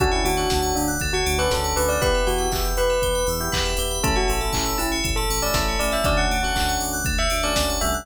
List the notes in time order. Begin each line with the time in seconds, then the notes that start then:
0.00 D2 C#4 D4 F#4 A4, kick, closed hi-hat
0.12 E4 C#5
0.24 D2 F#4 D5, open hi-hat
0.37 C#4 D4 F#4 A4 F#5
0.50 D2 C#4 D4 F#4 A4 A5, kick, snare
0.62 C#6
0.75 D2 D4 D6, open hi-hat
0.88 F#6
1.00 D2 A4, kick, closed hi-hat
1.13 F#4 C#5
1.26 D2 D5, open hi-hat
1.38 C#4 D4 F#4 A4 B4 F#5
1.50 D2 C#4 D4 F#4 A4 A5, kick, snare
1.64 C#6
1.76 D2 C#4 D4 F#4 A4 B4 D6, open hi-hat
1.89 D5 F#6
2.01 E2 B3 E4 G4 B4, kick, closed hi-hat
2.14 E5
2.27 E2 F#4 G5, open hi-hat
2.38 B3 E4 G4 B5
2.52 E2 B3 E4 G4 E6, kick, clap
2.65 G6
2.77 E2 B4, open hi-hat
2.90 E5
3.02 E2 G5, kick, closed hi-hat
3.15 B5
3.27 E2 E6, open hi-hat
3.40 B3 E4 G4 G6
3.52 E2 B3 E4 G4 B4, kick, clap
3.65 E5
3.77 E2 B3 E4 G4 G5, open hi-hat
3.91 B5
4.03 A1 A3 C#4 E4 A4, kick, closed hi-hat
4.16 F#4 C#5
4.28 A1 A4 E5, open hi-hat
4.41 A3 C#4 E4 A5
4.53 A1 A3 C#4 E4 C#6, kick, clap
4.65 E6
4.78 A1 E4 A4, open hi-hat
4.92 C#5
5.04 A1 E5, kick, closed hi-hat
5.16 A4 A5
5.30 A1 C#6, open hi-hat
5.42 A3 C#4 E4 D5 E6
5.54 A1 A3 C#4 E4 A4, kick, snare
5.68 C#5
5.79 A1 A3 C#4 E4 D5 E5, open hi-hat
5.92 E5 A5
6.04 D2 A3 C#4 D4 F#4 A4 D5, kick, closed hi-hat
6.17 C#5 F#5
6.30 D2 D5, open hi-hat
6.43 A3 C#4 D4 F#4 F#5
6.55 D2 A3 C#4 D4 F#4 A5, kick, clap
6.69 C#6
6.80 D2 D6, open hi-hat
6.93 F#6
7.05 D2 A4, kick, closed hi-hat
7.18 C#5 E5
7.30 D2 D5, open hi-hat
7.43 A3 C#4 D4 F#4 D5 F#5
7.55 C#2 A3 C#4 D4 F#4 D5 A5, kick, snare
7.70 C#6
7.81 C2 A3 C#4 D4 F#4 E5 D6, open hi-hat
7.94 F#6